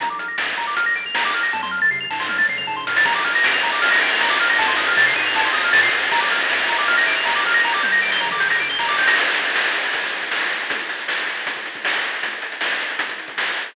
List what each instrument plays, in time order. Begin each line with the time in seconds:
0.00 synth bass 1 A#1, lead 1 (square) A#5, kick, closed hi-hat
0.10 lead 1 (square) D6
0.19 lead 1 (square) F6, closed hi-hat
0.28 lead 1 (square) A#6
0.38 synth bass 1 F2, lead 1 (square) D7, snare
0.48 lead 1 (square) F7
0.57 synth bass 1 C#2, lead 1 (square) A#5, closed hi-hat
0.67 lead 1 (square) D6
0.77 lead 1 (square) F6, kick, closed hi-hat
0.86 lead 1 (square) A#6, kick
0.95 synth bass 1 A#1, lead 1 (square) D7, closed hi-hat
1.05 lead 1 (square) F7, kick
1.14 synth bass 1 D#2, lead 1 (square) A#5, snare
1.25 lead 1 (square) D6
1.34 synth bass 1 A#1, lead 1 (square) F6, closed hi-hat
1.43 lead 1 (square) A#6
1.53 synth bass 1 F2, lead 1 (square) A5, kick, high tom
1.63 lead 1 (square) C6, high tom
1.71 lead 1 (square) F6
1.82 lead 1 (square) A6, mid tom
1.91 synth bass 1 C3, lead 1 (square) C7, floor tom
2.01 lead 1 (square) F7, floor tom
2.10 synth bass 1 G#2, lead 1 (square) A5, snare
2.20 lead 1 (square) C6, snare
2.29 lead 1 (square) F6, high tom
2.38 lead 1 (square) A6, high tom
2.48 synth bass 1 F2, lead 1 (square) C7, mid tom
2.58 lead 1 (square) F7, mid tom
2.67 synth bass 1 G#2, lead 1 (square) A5, floor tom
2.77 lead 1 (square) C6, floor tom
2.87 synth bass 1 A2, lead 1 (square) F6, snare
2.96 lead 1 (square) A6, snare
3.05 synth bass 1 A#1, lead 1 (square) A#5, kick, crash
3.15 lead 1 (square) D6, ride
3.24 lead 1 (square) F6, ride
3.35 lead 1 (square) A#6, ride
3.44 synth bass 1 F2, lead 1 (square) D7, snare
3.53 lead 1 (square) F7, ride
3.63 synth bass 1 C#2, lead 1 (square) A#5, ride
3.72 lead 1 (square) D6, ride
3.82 lead 1 (square) F6, kick, ride
3.91 lead 1 (square) A#6, ride
4.01 synth bass 1 A#1, lead 1 (square) D7, ride
4.11 lead 1 (square) F7, ride
4.20 synth bass 1 D#2, lead 1 (square) A#5, snare
4.30 lead 1 (square) D6, ride
4.39 synth bass 1 A#1, lead 1 (square) F6, ride
4.49 lead 1 (square) A#6, ride
4.59 synth bass 1 F2, lead 1 (square) A5, kick, ride
4.68 lead 1 (square) C6, ride
4.77 lead 1 (square) D#6, ride
4.87 lead 1 (square) F6, ride
4.97 synth bass 1 C3, lead 1 (square) A6, snare
5.06 lead 1 (square) C7, ride
5.16 synth bass 1 G#2, lead 1 (square) D#7, ride
5.25 lead 1 (square) F7, ride
5.35 lead 1 (square) A5, kick, ride
5.44 lead 1 (square) C6, ride
5.54 synth bass 1 F2, lead 1 (square) D#6, ride
5.64 lead 1 (square) F6, ride
5.73 synth bass 1 A#2, lead 1 (square) A6, snare
5.83 lead 1 (square) C7, ride
5.92 synth bass 1 F2, lead 1 (square) D#7, ride
6.02 lead 1 (square) F7, ride
6.11 synth bass 1 A#1, lead 1 (square) A#5, kick, ride
6.21 lead 1 (square) D6, ride
6.30 lead 1 (square) F6, ride
6.40 lead 1 (square) A#6, ride
6.50 synth bass 1 F2, lead 1 (square) D7, snare
6.59 lead 1 (square) F7, ride
6.69 synth bass 1 C#2, lead 1 (square) A#5, ride
6.78 lead 1 (square) D6, ride
6.88 lead 1 (square) F6, kick, ride
6.97 lead 1 (square) A#6, ride
7.07 synth bass 1 A#1, lead 1 (square) D7, ride
7.16 lead 1 (square) F7, ride
7.25 synth bass 1 D#2, lead 1 (square) A#5, snare
7.35 lead 1 (square) D6, ride
7.45 synth bass 1 A#1, lead 1 (square) F6, ride
7.54 lead 1 (square) A#6, ride
7.64 synth bass 1 G1, lead 1 (square) A#5, kick, snare
7.74 lead 1 (square) D6, snare
7.83 lead 1 (square) G6, high tom
7.92 lead 1 (square) A#6
8.02 synth bass 1 D2, lead 1 (square) D7, snare
8.12 lead 1 (square) G7, snare
8.21 synth bass 1 A#1, lead 1 (square) A#5, mid tom
8.31 lead 1 (square) D6, mid tom
8.40 lead 1 (square) G6, snare
8.50 lead 1 (square) A#6, snare
8.60 synth bass 1 G1, lead 1 (square) D7, floor tom
8.69 lead 1 (square) G7, floor tom
8.79 synth bass 1 C2, lead 1 (square) A#5, snare
8.89 lead 1 (square) D6, snare
8.98 synth bass 1 G1, lead 1 (square) G6, snare
9.07 lead 1 (square) A#6, snare
9.17 kick, crash
9.27 closed hi-hat
9.36 closed hi-hat
9.46 closed hi-hat
9.56 snare
9.65 closed hi-hat
9.74 closed hi-hat
9.84 closed hi-hat
9.93 kick, closed hi-hat
10.03 kick, closed hi-hat
10.13 closed hi-hat
10.23 kick, closed hi-hat
10.32 snare
10.41 closed hi-hat
10.51 closed hi-hat
10.61 closed hi-hat
10.70 kick, closed hi-hat
10.79 closed hi-hat
10.89 closed hi-hat
10.99 closed hi-hat
11.08 snare
11.18 closed hi-hat
11.27 closed hi-hat
11.37 closed hi-hat
11.47 kick, closed hi-hat
11.56 kick, closed hi-hat
11.66 closed hi-hat
11.75 kick, closed hi-hat
11.85 snare
11.94 closed hi-hat
12.04 closed hi-hat
12.13 closed hi-hat
12.23 kick, closed hi-hat
12.33 closed hi-hat
12.42 closed hi-hat
12.52 closed hi-hat
12.61 snare
12.71 closed hi-hat
12.80 closed hi-hat
12.90 closed hi-hat
12.99 kick, closed hi-hat
13.09 kick, closed hi-hat
13.18 closed hi-hat
13.28 kick, closed hi-hat
13.38 snare
13.47 closed hi-hat
13.57 closed hi-hat
13.66 closed hi-hat